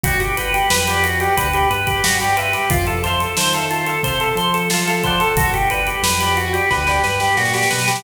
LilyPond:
<<
  \new Staff \with { instrumentName = "Drawbar Organ" } { \time 4/4 \key a \minor \tempo 4 = 90 fis'16 g'16 b'16 g'16 b'16 g'16 fis'16 g'16 b'16 g'16 b'16 g'16 fis'16 g'16 b'16 g'16 | f'16 a'16 c''16 a'16 c''16 a'16 f'16 a'16 c''16 a'16 c''16 a'16 f'16 a'16 c''16 a'16 | fis'16 g'16 b'16 g'16 b'16 g'16 fis'16 g'16 b'16 g'16 b'16 g'16 fis'16 g'16 b'16 g'16 | }
  \new Staff \with { instrumentName = "Pizzicato Strings" } { \time 4/4 \key a \minor <d'' fis'' g'' b''>8 <d'' fis'' g'' b''>8. <d'' fis'' g'' b''>8 <d'' fis'' g'' b''>16 <d'' fis'' g'' b''>16 <d'' fis'' g'' b''>8. <d'' fis'' g'' b''>16 <d'' fis'' g'' b''>16 <e'' f'' a'' c'''>8~ | <e'' f'' a'' c'''>8 <e'' f'' a'' c'''>8. <e'' f'' a'' c'''>8 <e'' f'' a'' c'''>16 <e'' f'' a'' c'''>16 <e'' f'' a'' c'''>8. <e'' f'' a'' c'''>16 <e'' f'' a'' c'''>16 <d'' fis'' g'' b''>8~ | <d'' fis'' g'' b''>8 <d'' fis'' g'' b''>8. <d'' fis'' g'' b''>8 <d'' fis'' g'' b''>16 <d'' fis'' g'' b''>16 <d'' fis'' g'' b''>8. <d'' fis'' g'' b''>16 <d'' fis'' g'' b''>8. | }
  \new Staff \with { instrumentName = "Synth Bass 1" } { \clef bass \time 4/4 \key a \minor g,,4 f,4 d,8 g,4. | f,4 ees4 c8 f4. | g,,4 f,4 d,8 g,8 bes,8 b,8 | }
  \new DrumStaff \with { instrumentName = "Drums" } \drummode { \time 4/4 <hh bd>16 hh16 hh16 hh16 sn16 <hh sn>16 hh16 hh16 <hh bd>16 hh16 hh16 <hh bd>16 sn16 hh16 hh16 <hh sn>16 | <hh bd>16 hh16 <hh sn>16 hh16 sn16 hh16 hh16 hh16 <hh bd>16 hh16 hh16 hh16 sn16 hh16 <hh bd>16 hh16 | <hh bd>16 hh16 hh16 hh16 sn16 hh16 hh16 <hh sn>16 <bd sn>16 sn16 sn16 sn16 sn32 sn32 sn32 sn32 sn32 sn32 sn32 sn32 | }
>>